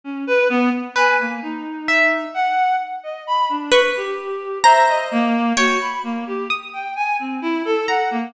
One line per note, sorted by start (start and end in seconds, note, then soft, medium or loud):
0.04 0.24 C#4 medium
0.27 0.48 B4 loud
0.49 0.70 B3 loud
0.96 1.79 B4 loud
0.96 1.17 G#5 medium
1.19 1.40 A#3 medium
1.42 2.25 D#4 medium
1.88 2.71 E5 loud
2.34 2.76 F#5 loud
3.03 3.24 D#5 medium
3.27 3.48 B5 loud
3.49 3.70 D4 medium
3.72 4.55 B4 medium
3.72 4.56 C#6 medium
3.96 4.58 G4 medium
4.64 5.48 C5 medium
4.64 4.85 E5 loud
4.64 5.47 A#5 loud
4.88 5.09 D#5 medium
5.11 5.53 A#3 loud
5.57 5.78 F#4 medium
5.57 5.99 C#5 medium
5.57 6.82 G5 medium
5.80 6.01 B5 medium
6.03 6.24 A#3 medium
6.27 6.48 G4 medium
6.50 6.92 D#6 medium
6.73 6.94 G5 medium
6.96 7.16 G#5 medium
7.19 7.40 C4 medium
7.42 7.62 E4 medium
7.65 7.86 A4 loud
7.88 8.09 F#5 medium
7.88 8.30 A#5 medium
8.11 8.32 A#3 medium